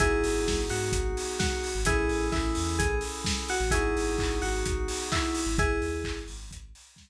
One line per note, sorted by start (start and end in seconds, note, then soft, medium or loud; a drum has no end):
0.00 0.22 G#1 medium
0.00 1.67 B3 medium
0.00 1.67 D#4 loud
0.00 0.59 E4 loud
0.00 1.67 F#4 loud
0.00 0.59 G#4 loud
0.00 1.67 G#4 loud
0.00 kick loud
0.00 closed hi-hat loud
0.24 0.45 G#1 medium
0.24 open hi-hat loud
0.46 0.67 G#1 medium
0.46 kick loud
0.46 snare loud
0.69 0.91 G#2 medium
0.69 1.37 F#4 medium
0.69 open hi-hat loud
0.92 1.13 G#1 medium
0.92 kick loud
0.92 closed hi-hat loud
1.17 open hi-hat loud
1.39 1.80 F#4 loud
1.39 kick loud
1.39 snare loud
1.64 open hi-hat medium
1.75 1.86 G#1 medium
1.85 2.06 A1 medium
1.85 3.53 C#4 loud
1.85 3.53 E4 medium
1.85 2.27 E4 loud
1.85 3.53 G#4 loud
1.85 2.27 G#4 loud
1.85 3.53 A4 loud
1.85 kick loud
1.85 closed hi-hat loud
2.09 2.30 A1 medium
2.09 open hi-hat medium
2.32 2.54 A1 medium
2.32 2.77 E4 loud
2.32 kick loud
2.32 clap loud
2.55 2.78 E2 medium
2.55 open hi-hat loud
2.79 3.00 A1 medium
2.79 2.98 G#4 loud
2.79 kick loud
2.79 closed hi-hat loud
3.01 open hi-hat medium
3.24 kick loud
3.24 snare loud
3.48 3.71 F#4 loud
3.48 open hi-hat loud
3.60 3.71 A1 medium
3.71 3.92 G#1 medium
3.71 5.40 B3 loud
3.71 5.40 D#4 loud
3.71 4.36 E4 loud
3.71 5.40 F#4 loud
3.71 4.36 G#4 loud
3.71 5.40 G#4 loud
3.71 kick loud
3.71 closed hi-hat loud
3.96 4.17 G#1 medium
3.96 open hi-hat loud
4.18 4.40 G#1 medium
4.18 kick loud
4.18 clap loud
4.42 4.63 G#1 medium
4.42 5.04 F#4 loud
4.42 open hi-hat medium
4.66 4.87 G#1 medium
4.66 kick loud
4.66 closed hi-hat loud
4.88 open hi-hat loud
5.12 5.55 E4 loud
5.12 kick loud
5.12 clap loud
5.35 open hi-hat loud
5.46 5.57 G#1 medium
5.58 5.79 G#1 medium
5.58 6.18 E4 loud
5.58 6.18 G#4 loud
5.58 kick loud
5.58 closed hi-hat loud
5.82 6.03 D#2 medium
5.82 open hi-hat medium
6.04 6.26 G#1 medium
6.04 kick loud
6.04 clap loud
6.28 6.50 G#1 medium
6.28 open hi-hat loud
6.50 6.71 G#1 medium
6.50 kick loud
6.50 closed hi-hat loud
6.75 open hi-hat loud
6.96 kick loud
6.96 snare loud